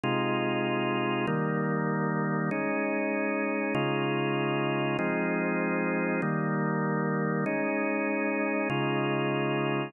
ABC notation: X:1
M:4/4
L:1/8
Q:1/4=97
K:Ab
V:1 name="Drawbar Organ"
[C,A,EF]4 [E,G,B,]4 | [A,DE]4 [D,A,EF]4 | [F,A,CE]4 [E,G,B,]4 | [A,DE]4 [D,A,EF]4 |]